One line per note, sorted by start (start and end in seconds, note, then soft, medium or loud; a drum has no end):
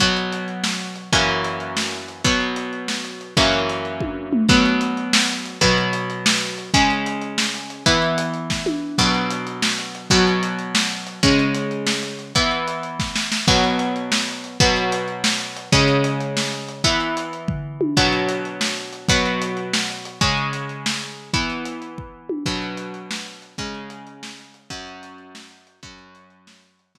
0.00 1.10 B2 medium
0.00 1.10 F#3 medium
0.00 1.10 B3 medium
0.00 kick medium
0.00 closed hi-hat loud
0.17 closed hi-hat medium
0.33 closed hi-hat medium
0.48 closed hi-hat medium
0.64 snare medium
0.81 closed hi-hat medium
0.96 closed hi-hat medium
1.13 2.23 F#2 medium
1.13 2.23 E3 medium
1.13 2.23 A#3 medium
1.13 2.23 C#4 medium
1.13 kick medium
1.13 closed hi-hat medium
1.44 closed hi-hat medium
1.60 closed hi-hat medium
1.77 snare medium
1.93 closed hi-hat medium
2.08 closed hi-hat medium
2.24 3.34 B2 medium
2.24 3.34 F#3 medium
2.24 3.34 B3 medium
2.24 kick medium
2.24 closed hi-hat medium
2.40 closed hi-hat medium
2.56 closed hi-hat medium
2.73 closed hi-hat medium
2.88 snare medium
3.05 closed hi-hat medium
3.21 closed hi-hat medium
3.37 4.47 F#2 medium
3.37 4.47 E3 medium
3.37 4.47 A#3 medium
3.37 4.47 C#4 medium
3.37 kick medium
3.37 closed hi-hat medium
3.53 closed hi-hat medium
3.70 closed hi-hat medium
3.85 closed hi-hat medium
4.00 kick medium
4.00 high tom medium
4.33 mid tom loud
4.49 5.59 B2 medium
4.49 5.59 F#3 medium
4.49 5.59 B3 medium
4.49 kick loud
4.49 crash medium
4.65 closed hi-hat medium
4.81 closed hi-hat medium
4.97 closed hi-hat medium
5.13 snare loud
5.29 closed hi-hat medium
5.46 closed hi-hat medium
5.61 6.71 B2 medium
5.61 6.71 F#3 medium
5.61 6.71 B3 medium
5.61 kick medium
5.61 closed hi-hat loud
5.78 closed hi-hat medium
5.93 closed hi-hat medium
6.10 closed hi-hat medium
6.26 snare loud
6.41 closed hi-hat medium
6.58 closed hi-hat medium
6.74 7.84 C#3 medium
6.74 7.84 G#3 medium
6.74 7.84 C#4 medium
6.74 kick medium
6.74 closed hi-hat loud
6.90 closed hi-hat medium
7.06 closed hi-hat medium
7.22 closed hi-hat medium
7.38 snare medium
7.54 closed hi-hat medium
7.70 closed hi-hat medium
7.86 8.96 E3 medium
7.86 8.96 B3 medium
7.86 8.96 E4 medium
7.86 kick medium
7.86 closed hi-hat loud
8.02 closed hi-hat medium
8.18 closed hi-hat loud
8.34 closed hi-hat medium
8.50 kick medium
8.50 snare medium
8.66 high tom medium
8.98 10.09 B2 medium
8.98 10.09 F#3 medium
8.98 10.09 B3 medium
8.98 kick medium
8.98 crash loud
9.14 closed hi-hat medium
9.30 closed hi-hat loud
9.47 closed hi-hat medium
9.62 snare loud
9.79 closed hi-hat medium
9.95 closed hi-hat medium
10.10 11.21 B2 medium
10.10 11.21 F#3 medium
10.10 11.21 B3 medium
10.10 kick medium
10.10 closed hi-hat loud
10.27 closed hi-hat medium
10.43 closed hi-hat medium
10.59 closed hi-hat medium
10.75 snare loud
10.91 closed hi-hat medium
11.07 closed hi-hat medium
11.23 12.33 C#3 medium
11.23 12.33 G#3 medium
11.23 12.33 C#4 medium
11.23 kick loud
11.23 closed hi-hat medium
11.39 closed hi-hat medium
11.55 closed hi-hat medium
11.71 closed hi-hat medium
11.87 snare medium
12.03 closed hi-hat medium
12.19 closed hi-hat medium
12.35 13.46 E3 medium
12.35 13.46 B3 medium
12.35 13.46 E4 medium
12.35 kick medium
12.35 closed hi-hat medium
12.51 closed hi-hat medium
12.68 closed hi-hat medium
12.83 closed hi-hat medium
13.00 kick medium
13.00 snare medium
13.16 snare medium
13.32 snare medium
13.48 14.58 B2 medium
13.48 14.58 F#3 medium
13.48 14.58 B3 medium
13.48 kick loud
13.48 crash medium
13.64 closed hi-hat medium
13.79 closed hi-hat medium
13.96 closed hi-hat medium
14.12 snare loud
14.28 closed hi-hat medium
14.44 closed hi-hat medium
14.60 15.70 B2 medium
14.60 15.70 F#3 loud
14.60 15.70 B3 medium
14.60 kick loud
14.60 closed hi-hat medium
14.76 closed hi-hat medium
14.92 closed hi-hat loud
15.08 closed hi-hat medium
15.24 snare loud
15.40 closed hi-hat medium
15.57 closed hi-hat medium
15.72 16.82 C#3 medium
15.72 16.82 G#3 medium
15.72 16.82 C#4 medium
15.72 kick loud
15.72 closed hi-hat loud
15.88 closed hi-hat medium
16.04 closed hi-hat medium
16.21 closed hi-hat medium
16.37 snare medium
16.52 closed hi-hat medium
16.69 closed hi-hat medium
16.84 17.94 E3 medium
16.84 17.94 B3 medium
16.84 17.94 E4 medium
16.84 kick medium
16.84 closed hi-hat loud
17.00 closed hi-hat medium
17.17 closed hi-hat medium
17.33 closed hi-hat medium
17.48 kick medium
17.48 floor tom medium
17.81 high tom medium
17.97 19.07 B2 medium
17.97 19.07 F#3 medium
17.97 19.07 B3 medium
17.97 kick medium
17.97 crash medium
18.13 closed hi-hat medium
18.29 closed hi-hat medium
18.45 closed hi-hat medium
18.61 snare medium
18.77 closed hi-hat medium
18.93 closed hi-hat medium
19.08 20.19 B2 medium
19.08 20.19 F#3 medium
19.08 20.19 B3 medium
19.08 kick loud
19.08 closed hi-hat loud
19.26 closed hi-hat medium
19.42 closed hi-hat loud
19.57 closed hi-hat medium
19.73 snare loud
19.90 closed hi-hat medium
20.05 closed hi-hat medium
20.21 21.31 C#3 medium
20.21 21.31 G#3 loud
20.21 21.31 C#4 medium
20.21 kick loud
20.21 closed hi-hat loud
20.37 closed hi-hat medium
20.53 closed hi-hat medium
20.69 closed hi-hat medium
20.86 snare loud
21.02 closed hi-hat medium
21.33 22.44 E3 medium
21.33 22.44 B3 medium
21.33 22.44 E4 medium
21.33 kick loud
21.33 closed hi-hat medium
21.50 closed hi-hat medium
21.65 closed hi-hat loud
21.82 closed hi-hat medium
21.98 kick medium
22.29 high tom loud
22.46 23.56 B2 medium
22.46 23.56 F#3 medium
22.46 23.56 B3 medium
22.46 kick medium
22.46 crash medium
22.62 closed hi-hat medium
22.77 closed hi-hat loud
22.94 closed hi-hat medium
23.11 snare loud
23.26 closed hi-hat medium
23.42 closed hi-hat medium
23.58 24.69 C#3 medium
23.58 24.69 G#3 medium
23.58 24.69 C#4 medium
23.58 kick medium
23.58 closed hi-hat loud
23.74 closed hi-hat medium
23.90 closed hi-hat loud
24.07 closed hi-hat medium
24.23 snare loud
24.38 closed hi-hat medium
24.54 closed hi-hat medium
24.70 25.80 F#2 loud
24.70 25.80 F#3 medium
24.70 25.80 C#4 medium
24.70 kick medium
24.70 closed hi-hat medium
24.87 closed hi-hat medium
25.03 closed hi-hat loud
25.18 closed hi-hat medium
25.35 snare loud
25.51 closed hi-hat medium
25.67 closed hi-hat medium
25.83 26.93 F#2 medium
25.83 26.93 F#3 medium
25.83 26.93 C#4 medium
25.83 kick loud
25.83 closed hi-hat medium
25.98 closed hi-hat medium
26.15 closed hi-hat medium
26.30 closed hi-hat medium
26.47 snare loud
26.63 closed hi-hat medium
26.79 closed hi-hat medium
26.95 26.98 B2 medium
26.95 26.98 F#3 medium
26.95 26.98 B3 medium
26.95 kick medium